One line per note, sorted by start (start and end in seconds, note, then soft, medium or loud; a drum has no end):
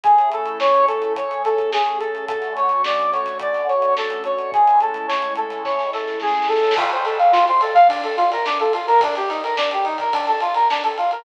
0.04 1.14 A3 medium
0.04 1.14 C#4 medium
0.04 1.14 E4 medium
0.04 0.29 G#4 medium
0.04 1.14 G#4 medium
0.04 kick medium
0.04 closed hi-hat medium
0.18 closed hi-hat medium
0.32 0.58 A4 medium
0.32 closed hi-hat medium
0.46 closed hi-hat medium
0.60 0.86 C#5 medium
0.60 snare medium
0.74 closed hi-hat medium
0.87 1.13 A4 medium
0.87 closed hi-hat medium
1.02 closed hi-hat medium
1.16 2.27 A3 medium
1.16 2.27 C#4 medium
1.16 2.27 G#4 medium
1.16 2.27 A4 medium
1.16 1.42 C#5 medium
1.16 kick medium
1.16 closed hi-hat medium
1.31 closed hi-hat medium
1.44 1.70 A4 medium
1.44 snare soft
1.44 closed hi-hat medium
1.58 kick medium
1.58 closed hi-hat medium
1.72 1.98 G#4 medium
1.72 snare medium
1.86 closed hi-hat medium
1.99 2.25 A4 medium
1.99 closed hi-hat medium
2.15 closed hi-hat soft
2.28 4.50 D3 medium
2.28 4.50 A3 medium
2.28 4.50 C#4 medium
2.28 4.50 F#4 medium
2.28 2.54 A4 medium
2.28 kick medium
2.28 closed hi-hat medium
2.42 snare soft
2.42 closed hi-hat soft
2.56 2.82 C#5 medium
2.56 closed hi-hat medium
2.69 closed hi-hat medium
2.84 3.11 D5 medium
2.84 snare medium
3.00 closed hi-hat medium
3.12 3.38 C#5 medium
3.12 snare soft
3.12 closed hi-hat medium
3.26 snare soft
3.26 closed hi-hat medium
3.39 3.67 D5 medium
3.39 kick medium
3.39 closed hi-hat medium
3.54 snare soft
3.54 closed hi-hat medium
3.68 3.94 C#5 soft
3.68 closed hi-hat medium
3.82 closed hi-hat medium
3.97 4.23 A4 medium
3.97 snare medium
4.10 closed hi-hat medium
4.24 4.51 C#5 medium
4.24 closed hi-hat medium
4.38 closed hi-hat soft
4.52 6.75 A2 medium
4.52 6.75 G#3 medium
4.52 6.75 C#4 medium
4.52 6.75 E4 medium
4.52 4.79 G#4 medium
4.52 kick medium
4.52 closed hi-hat medium
4.67 closed hi-hat medium
4.80 5.07 A4 medium
4.80 closed hi-hat medium
4.94 closed hi-hat medium
5.08 5.34 C#5 medium
5.08 snare medium
5.22 closed hi-hat medium
5.35 5.62 A4 soft
5.35 closed hi-hat medium
5.50 snare soft
5.50 closed hi-hat medium
5.64 5.90 C#5 medium
5.64 kick medium
5.64 snare medium
5.79 snare soft
5.93 6.19 A4 medium
5.93 snare medium
6.07 snare medium
6.20 6.48 G#4 medium
6.20 snare medium
6.27 snare medium
6.34 snare medium
6.42 snare medium
6.48 6.74 A4 medium
6.48 snare medium
6.56 snare medium
6.63 snare medium
6.71 snare medium
6.77 6.90 F4 medium
6.77 kick medium
6.77 crash medium
6.90 7.05 C5 medium
6.90 ride medium
7.04 7.17 A4 medium
7.04 snare soft
7.04 ride medium
7.18 7.31 F5 medium
7.18 ride medium
7.32 7.45 F4 medium
7.32 snare medium
7.47 7.61 C5 medium
7.47 snare soft
7.47 ride medium
7.61 7.74 A4 medium
7.61 ride medium
7.74 7.87 F5 medium
7.74 kick medium
7.74 ride medium
7.88 8.01 D4 medium
7.88 kick medium
7.88 ride medium
8.03 8.16 A4 medium
8.03 ride medium
8.17 8.30 F4 medium
8.17 snare soft
8.17 ride medium
8.30 8.45 A#4 medium
8.30 snare soft
8.30 ride medium
8.45 8.58 D4 medium
8.45 snare medium
8.59 8.73 A4 medium
8.59 ride medium
8.73 8.86 F4 medium
8.73 ride medium
8.87 9.00 A#4 medium
8.87 ride medium
9.00 9.15 D4 medium
9.00 kick medium
9.00 ride medium
9.15 9.29 G4 medium
9.15 snare soft
9.15 ride medium
9.29 9.41 D#4 medium
9.29 snare soft
9.29 ride medium
9.43 9.56 A#4 medium
9.43 ride medium
9.57 9.70 D4 medium
9.57 snare loud
9.71 9.85 G4 medium
9.71 ride medium
9.84 9.97 D#4 medium
9.84 ride medium
9.98 10.13 A#4 medium
9.98 kick medium
9.98 ride medium
10.13 10.26 D4 medium
10.13 kick medium
10.13 ride medium
10.27 10.40 A4 medium
10.27 ride medium
10.40 10.54 F4 medium
10.40 ride medium
10.54 10.68 A#4 medium
10.54 ride medium
10.70 10.83 D4 medium
10.70 snare medium
10.83 10.97 A4 medium
10.83 snare soft
10.83 ride medium
10.98 11.11 F4 medium
10.98 ride medium
11.11 11.24 A#4 medium
11.11 ride medium